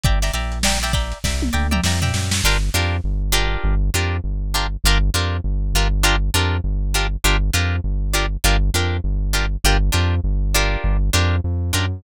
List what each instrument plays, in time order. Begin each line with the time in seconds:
0.04 synth bass 1 G1, pizzicato strings D5 E5 G5 A#5, kick, closed hi-hat
0.22 pizzicato strings D5 E5 G5 A#5, snare, closed hi-hat
0.34 synth bass 1 A#1, pizzicato strings D5 E5 G5 A#5, closed hi-hat
0.52 closed hi-hat
0.63 pizzicato strings D5 E5 G5 A#5, snare
0.82 pizzicato strings D5 E5 G5 A#5, snare, closed hi-hat
0.93 pizzicato strings D5 E5 G5 A#5, kick, closed hi-hat
1.12 closed hi-hat
1.24 synth bass 1 C2, pizzicato strings D5 E5 G5 A#5, kick, snare
1.42 high tom
1.53 synth bass 1 D2, pizzicato strings D5 E5 G5 A#5
1.71 pizzicato strings D5 E5 G5 A#5, mid tom
1.84 synth bass 1 F2, pizzicato strings D5 E5 G5 A#5, snare
2.02 pizzicato strings D5 E5 G5 A#5, floor tom
2.14 synth bass 1 F#2, snare
2.31 snare
2.44 synth bass 1 G1, pizzicato strings D4 F4 G4 A#4
2.74 synth bass 1 F2, pizzicato strings D4 F4 G4 A#4
3.04 synth bass 1 G1
3.32 pizzicato strings D4 F4 G4 A#4
3.64 synth bass 1 G1
3.94 synth bass 1 F2, pizzicato strings D4 F4 G4 A#4
4.24 synth bass 1 G1
4.54 pizzicato strings D4 F4 G4 A#4
4.84 synth bass 1 G1, pizzicato strings D4 F4 G4 A#4
5.14 synth bass 1 F2, pizzicato strings D4 F4 G4 A#4
5.44 synth bass 1 G1
5.74 synth bass 1 G1, pizzicato strings D4 F4 G4 A#4
6.03 pizzicato strings D4 F4 G4 A#4
6.34 synth bass 1 F2, pizzicato strings D4 F4 G4 A#4
6.64 synth bass 1 G1
6.94 pizzicato strings D4 F4 G4 A#4
7.24 synth bass 1 G1, pizzicato strings D4 F4 G4 A#4
7.54 synth bass 1 F2, pizzicato strings D4 F4 G4 A#4
7.84 synth bass 1 G1
8.13 pizzicato strings D4 F4 G4 A#4
8.44 synth bass 1 G1, pizzicato strings D4 F4 G4 A#4
8.74 synth bass 1 F2, pizzicato strings D4 F4 G4 A#4
9.04 synth bass 1 G1
9.33 pizzicato strings D4 F4 G4 A#4
9.64 synth bass 1 G1, pizzicato strings D4 F4 G4 A#4
9.92 synth bass 1 F2, pizzicato strings D4 F4 G4 A#4
10.24 synth bass 1 G1
10.54 pizzicato strings D4 F4 G4 A#4
10.84 synth bass 1 G1
11.13 synth bass 1 F2, pizzicato strings D4 F4 G4 A#4
11.44 synth bass 1 F2
11.73 synth bass 1 F#2, pizzicato strings D4 F4 G4 A#4